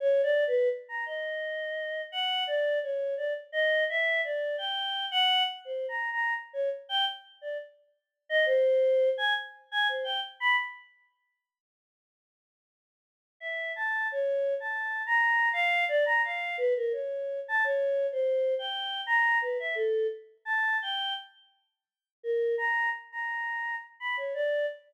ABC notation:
X:1
M:5/4
L:1/16
Q:1/4=85
K:none
V:1 name="Choir Aahs"
(3_d2 =d2 B2 z _b _e6 _g2 d2 _d2 =d z | _e2 =e2 d2 g3 _g2 z (3c2 _b2 b2 z _d z =g | z2 d z4 _e c4 _a z2 a c g z b | z16 e2 a2 |
(3_d4 a4 _b4 f2 =d b f2 =B _B _d3 a | (3_d4 c4 g4 _b2 =B e A2 z2 a2 g2 | z6 _B2 _b2 z b4 z =b _d =d2 |]